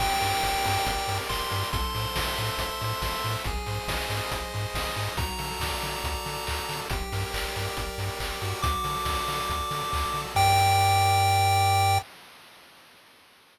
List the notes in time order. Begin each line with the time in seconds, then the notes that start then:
0.00 G1 G4 G5, kick, crash
0.21 G2 A#4, open hi-hat
0.42 G1 D5, kick, clap
0.64 G2 A#4, open hi-hat
0.86 G1 G4, kick, closed hi-hat
1.08 G2 A#4, open hi-hat
1.29 G1 D5 C6, kick, clap
1.51 G2 A#4, open hi-hat
1.72 A1 A4 C6, kick, closed hi-hat
1.94 A2 C5, open hi-hat
2.16 A1 E5, kick, snare
2.38 A2 C5, open hi-hat
2.58 A1 A4, kick, closed hi-hat
2.81 A2 C5, open hi-hat
3.02 A1 E5, kick, snare
3.24 A2 C5, open hi-hat
3.44 G#1 G#4, kick, closed hi-hat
3.66 G#2 C5, open hi-hat
3.88 G#1 D#5, kick, snare
4.09 G#2 C5, open hi-hat
4.31 G#1 G#4, kick, closed hi-hat
4.54 G#2 C5, open hi-hat
4.74 G#1 D#5, kick, snare
4.96 G#2 C5, open hi-hat
5.17 D2 F#4 A#5, kick, closed hi-hat
5.39 D3 A4, open hi-hat
5.60 D2 D5, kick, snare
5.82 D3 A4, open hi-hat
6.04 D2 F#4, kick, closed hi-hat
6.25 D3 A4, open hi-hat
6.47 D2 D5, kick, clap
6.68 D3 A4, open hi-hat
6.90 G1 G4, kick, closed hi-hat
7.12 G2 A#4, open hi-hat
7.34 G1 D5, kick, clap
7.56 G2 A#4, open hi-hat
7.77 G1 G4, kick, closed hi-hat
7.98 G2 A#4, open hi-hat
8.20 G1 D5, kick, clap
8.41 G2 F#4, open hi-hat
8.62 D2 D6, kick, closed hi-hat
8.84 D3 A4, open hi-hat
9.05 D2 D5, kick, snare
9.28 D3 A4, open hi-hat
9.50 D2 F#4, kick, closed hi-hat
9.71 D3 A4, open hi-hat
9.92 D2 D5, kick, clap
10.14 D3 A4, open hi-hat
10.35 G2 G4 A#4 D5 G5, kick, crash